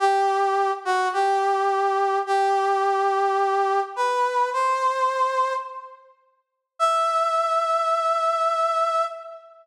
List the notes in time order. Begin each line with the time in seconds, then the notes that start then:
0.00 G4
0.85 F#4
1.13 G4
2.27 G4
3.96 B4
4.53 C5
6.79 E5